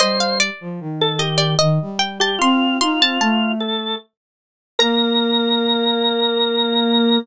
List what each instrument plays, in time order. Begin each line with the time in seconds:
0.00 flute G3, drawbar organ C5, harpsichord D#5
0.20 harpsichord F5
0.40 harpsichord D5
0.61 flute F3
0.80 flute D#3
1.01 drawbar organ A4
1.19 drawbar organ G4, harpsichord D#5
1.38 harpsichord D5
1.59 flute D#3, harpsichord D#5
1.82 flute G3
1.99 harpsichord G5
2.20 drawbar organ G4, harpsichord A5
2.39 flute C4, drawbar organ F4, harpsichord C6
2.81 flute D#4, drawbar organ F4, harpsichord C6
2.99 flute C4, harpsichord A5
3.20 flute A3, harpsichord A5
3.60 drawbar organ A4
4.79 flute A#3, drawbar organ A#4, harpsichord A#5